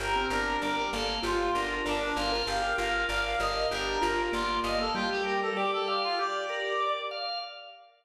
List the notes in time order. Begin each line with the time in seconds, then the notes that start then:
0.00 G1 G4 A#4
0.16 C4
0.30 G1 D4 A#4
0.62 G1 G3 A#4 D5
0.76 A#4
0.93 G1 A#3 A4 F5
1.23 G1 F4 G4
1.55 G1 D4 A#4
1.85 G1 D4 A#4 D5
2.16 G1 F4 F5
2.32 F4 A#4
2.47 G1 G4 F5
2.62 G4
2.77 G1 F4 A#4 F5
3.09 G1 A#4 D5 F5
3.25 F5
3.40 G1 A#4 D#5 F5
3.71 G1 D4 G4 A#4
4.02 G1 F4 A#4
4.32 G1 A#3 F4 D5
4.64 G1 D#5 F5
4.78 A#3 A4
4.95 G3 F4 G4
5.11 G4
5.25 G4 A#4
5.42 A4
5.56 G4 D5
5.73 A4
5.88 G4 F5
6.04 F4
6.19 G4 D5
6.49 A#4
6.80 D5
7.11 F5